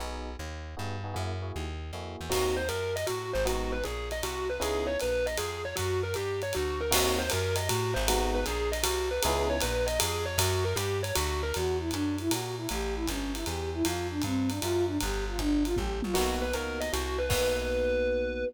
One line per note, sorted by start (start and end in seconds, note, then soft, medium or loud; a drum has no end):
0.00 0.36 B1 medium
0.00 0.30 B3 medium
0.00 0.30 D#4 medium
0.00 0.30 F#4 medium
0.00 0.30 G#4 medium
0.39 0.75 D#2 medium
0.77 1.15 G2 medium
0.77 0.95 B3 medium
0.77 0.95 D#4 medium
0.77 0.95 F#4 medium
0.77 0.95 G#4 medium
1.04 1.12 B3 medium
1.04 1.12 D#4 medium
1.04 1.12 F#4 medium
1.04 1.12 G#4 medium
1.14 1.52 F#2 medium
1.14 1.32 A#3 medium
1.14 1.32 E4 medium
1.14 1.32 F#4 medium
1.14 1.32 G#4 medium
1.42 1.65 A#3 medium
1.42 1.65 E4 medium
1.42 1.65 F#4 medium
1.42 1.65 G#4 medium
1.56 1.92 D#2 medium
1.93 2.16 F2 medium
1.93 2.25 A#3 medium
1.93 2.25 E4 medium
1.93 2.25 F#4 medium
1.93 2.25 G#4 medium
2.21 2.32 E2 medium
2.29 2.69 D#2 medium
2.29 2.60 A#3 loud
2.29 2.60 C4 medium
2.29 2.60 D#4 medium
2.29 2.60 F#4 medium
2.29 2.55 F#4 medium
2.29 kick medium
2.29 crash medium
2.29 ride medium
2.57 2.68 C5 medium
2.69 3.05 F#2 medium
2.69 2.93 A#4 medium
2.69 hi-hat pedal medium
2.69 ride medium
2.96 3.07 D#5 medium
2.96 ride medium
3.07 3.34 A2 medium
3.07 3.31 F#4 medium
3.07 ride medium
3.33 3.83 G#1 medium
3.33 3.45 C5 medium
3.45 3.76 G#3 loud
3.45 3.76 B3 loud
3.45 3.76 D#4 medium
3.45 3.76 F#4 loud
3.45 3.71 F#4 medium
3.45 ride medium
3.72 3.83 B4 medium
3.84 4.22 A#1 medium
3.84 4.09 G#4 medium
3.84 hi-hat pedal medium
3.84 ride medium
4.11 4.23 D#5 medium
4.11 ride medium
4.23 4.59 C2 medium
4.23 4.47 F#4 medium
4.23 ride medium
4.50 4.61 B4 medium
4.60 4.97 C#2 medium
4.60 4.91 B3 medium
4.60 4.91 C#4 loud
4.60 4.91 D#4 medium
4.60 4.91 E4 loud
4.60 4.86 G#4 medium
4.60 ride medium
4.87 4.98 C#5 medium
5.00 5.39 A#1 medium
5.00 5.26 B4 medium
5.00 hi-hat pedal medium
5.00 ride medium
5.26 5.38 D#5 medium
5.26 ride medium
5.37 5.74 F2 medium
5.37 5.62 G#4 medium
5.37 ride medium
5.65 5.76 C#5 medium
5.76 6.15 F#2 medium
5.76 6.00 F#4 medium
5.76 kick soft
5.76 ride medium
6.03 6.14 A#4 medium
6.14 6.53 G2 medium
6.14 6.40 G4 medium
6.14 hi-hat pedal medium
6.14 ride medium
6.42 6.54 C#5 medium
6.42 ride medium
6.53 6.92 D2 medium
6.53 6.79 F#4 medium
6.53 ride medium
6.81 6.92 A#4 medium
6.91 7.30 D#2 loud
6.91 7.22 A#3 loud
6.91 7.22 C4 loud
6.91 7.22 D#4 loud
6.91 7.22 F#4 loud
6.91 7.18 F#4 medium
6.91 kick medium
6.91 crash loud
6.91 ride loud
7.18 7.29 C5 medium
7.30 7.69 F#2 loud
7.30 7.56 A#4 medium
7.30 hi-hat pedal medium
7.30 ride loud
7.56 7.67 D#5 medium
7.56 ride loud
7.69 7.95 A2 medium
7.69 7.93 F#4 medium
7.69 ride loud
7.94 8.44 G#1 loud
7.94 8.05 C5 medium
8.08 8.40 G#3 loud
8.08 8.40 B3 loud
8.08 8.40 D#4 loud
8.08 8.32 F#4 medium
8.08 8.40 F#4 loud
8.08 ride loud
8.35 8.46 B4 medium
8.45 8.83 A#1 medium
8.45 8.70 G#4 medium
8.45 hi-hat pedal medium
8.45 ride medium
8.72 8.83 D#5 medium
8.72 ride medium
8.83 9.20 C2 medium
8.83 9.07 F#4 medium
8.83 ride loud
9.11 9.22 B4 medium
9.22 9.61 C#2 loud
9.22 9.56 B3 loud
9.22 9.56 C#4 loud
9.22 9.56 D#4 loud
9.22 9.56 E4 loud
9.22 9.46 G#4 medium
9.22 ride loud
9.50 9.61 C#5 medium
9.60 9.99 A#1 medium
9.60 9.86 B4 medium
9.60 hi-hat pedal medium
9.60 ride loud
9.87 9.98 D#5 medium
9.87 ride medium
10.00 10.37 F2 medium
10.00 10.24 G#4 medium
10.00 ride loud
10.25 10.37 C#5 medium
10.38 10.74 F#2 loud
10.38 10.63 F#4 medium
10.38 kick medium
10.38 ride loud
10.65 10.76 A#4 medium
10.76 11.12 G2 medium
10.76 11.00 G4 medium
10.76 hi-hat pedal medium
10.76 ride loud
11.03 11.14 C#5 medium
11.03 ride medium
11.15 11.53 D2 loud
11.15 11.40 F#4 medium
11.15 ride loud
11.43 11.54 A#4 medium
11.53 11.92 E2 medium
11.53 11.77 F#4 medium
11.53 ride medium
11.79 11.90 E4 medium
11.91 12.29 F#2 medium
11.91 12.16 D4 medium
11.91 hi-hat pedal medium
11.91 ride medium
12.18 12.31 E4 medium
12.18 ride medium
12.30 12.67 A#2 medium
12.30 12.55 F#4 medium
12.30 ride loud
12.57 12.68 E4 medium
12.69 13.07 A1 medium
12.69 12.95 G4 medium
12.69 ride medium
12.95 13.06 E4 medium
13.07 13.45 G1 medium
13.07 13.33 C#4 medium
13.07 kick medium
13.07 hi-hat pedal medium
13.07 ride medium
13.34 13.45 E4 medium
13.34 ride medium
13.46 13.83 E2 medium
13.46 13.71 G4 medium
13.46 ride medium
13.73 13.84 E4 medium
13.83 14.22 F2 loud
13.83 14.07 F4 medium
13.83 ride loud
14.10 14.22 D4 medium
14.22 14.60 G2 medium
14.22 14.49 C4 medium
14.22 kick medium
14.22 hi-hat pedal medium
14.22 ride medium
14.49 14.60 D4 medium
14.49 ride medium
14.60 14.99 F#2 medium
14.60 14.84 F4 medium
14.60 ride medium
14.86 14.98 D4 medium
15.00 15.38 G1 loud
15.00 15.25 G4 medium
15.00 kick medium
15.00 ride medium
15.28 15.39 F4 medium
15.38 15.75 G1 medium
15.38 15.63 D4 medium
15.38 kick medium
15.38 hi-hat pedal medium
15.64 15.75 F4 medium
15.64 ride medium
15.75 16.01 A1 medium
15.75 16.00 G4 medium
15.75 kick medium
15.75 high tom medium
16.02 16.15 A#1 medium
16.02 16.15 F4 medium
16.02 high tom loud
16.14 16.53 B1 medium
16.14 16.45 A#3 loud
16.14 16.45 B3 loud
16.14 16.45 D#4 loud
16.14 16.38 F#4 medium
16.14 16.45 F#4 loud
16.14 kick soft
16.14 crash medium
16.14 ride medium
16.42 16.53 B4 medium
16.53 16.91 C#2 medium
16.53 16.86 A#3 medium
16.53 16.86 B3 medium
16.53 16.86 D#4 medium
16.53 16.86 F#4 medium
16.53 16.79 A#4 medium
16.53 hi-hat pedal medium
16.53 ride medium
16.80 16.92 D#5 medium
16.80 ride medium
16.93 17.29 C2 medium
16.93 17.17 F#4 medium
16.93 ride medium
17.19 17.30 B4 medium
17.29 18.44 B1 medium
17.29 18.43 A#3 medium
17.29 18.43 B3 loud
17.29 18.43 D#4 medium
17.29 18.43 F#4 loud
17.29 18.44 B4 loud
17.29 kick loud
17.29 crash loud